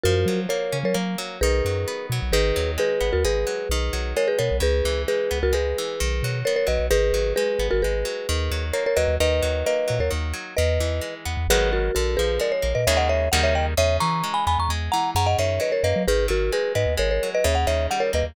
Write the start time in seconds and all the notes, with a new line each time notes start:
0.04 F#2 F3 F#4 A#4
0.26 F#3
0.49 A#3 A#4 C#5
0.72 C#3 C#4
0.83 F#3 A#4 C#5
0.94 F#3 A#3
1.18 F#3
1.41 B1 D#3 G#4 B4
1.65 F#2 F#3
1.88 B3
2.10 B2 F#3
2.22 B1
2.32 G#1 D#3 G#4 B4
2.56 D#2 F#3
2.78 G#3 G#4 B4
3.01 G#1 B3
3.13 D#2 F#4 A#4
3.24 G#1 G#3 G#4 B4
3.47 F#3
3.69 B1 D#3
3.93 B1 F#3
4.17 G#3 A#4 C#5
4.28 G#4 B4
4.39 B2 B3 A#4 C#5
4.51 B1
4.60 C#2 C#3 G#4 B4
4.85 C#2 E3
5.08 G#3 G#4 B4
5.31 C#2 B3
5.43 C#2 F#4 A#4
5.53 C#2 G#3 G#4 B4
5.78 E3
6.00 B1 D#3
6.23 B2 F#3
6.45 B3 A#4 C#5
6.56 A#4 C#5
6.67 B1 F#3 B4 D#5
6.79 B1
6.91 G#1 D#3 G#4 B4
7.13 G#1 F#3
7.36 G#3 G#4 B4
7.59 G#1 B3
7.71 G#1 F#4 A#4
7.82 G#1 G#3 G#4 B4
8.05 F#3
8.29 D#2 D#3
8.51 D#2 F#3
8.73 A#3 A#4 C#5
8.86 A#4 C#5
8.96 D#2 F#3 B4 D#5
9.08 D#2
9.20 D#2 D#3 B4 D#5
9.42 D#2 F#3
9.66 A#3 B4 D#5
9.88 A#2 F#3
9.99 D#2 A#4 C#5
10.10 D#2 D#3
10.33 F#3
10.57 E2 D#3 B4 D#5
10.80 E2 E3
11.01 G#3
11.25 E2 B3
11.37 E2
11.48 G#1 D#3 F#3 G#3 B3 G#4 B4
11.73 F#4 A#4
11.95 A#1 D3 F#4 A#4
12.17 A#1 F3 G#4 B4
12.40 G#3 A#4 D5
12.52 C#5
12.62 A#1 A#3
12.75 A#2 B4 D#5
12.87 D#2 C#3 D#3 G#3 A#3 C#5 E5
12.97 D#5 F#5
13.09 C#5 E5
13.32 D#2 C#3 D#3 G3 A#3 F#5
13.43 C#5 E5
13.55 D#5 G5
13.77 E2 C#3 C#5 E5
14.00 E3 A#5 C#6
14.24 G#3
14.34 G#5 B5
14.47 E2 B3 G#5 B5
14.59 E2 A#5 C#6
14.69 E2 G#3
14.92 E3 F#5 A#5
15.15 F#2 C#3 F#5 A#5
15.26 D#5 F#5
15.38 F#2 D#3 C#5 E5
15.60 F#3 B4 D#5
15.72 A#4 C#5
15.83 F#2 A#3 B4 D#5
15.96 F#3
16.07 G#1 D#3 G#4 B4
16.28 G#1 F#3 F#4 A#4
16.52 G#3 G#4 B4
16.75 G#2 B3 B4 D#5
16.86 D#2
16.97 G#1 G#3 A#4 C#5
17.11 A#4 C#5
17.23 F#3
17.35 B4 D#5
17.44 D#2 C#3 C#5 E5
17.55 F#5
17.67 D#2 D#3 C#5 E5
17.91 G3 F#5
18.00 A#4 C#5
18.13 D#2 A#3 B4 D#5
18.24 D#2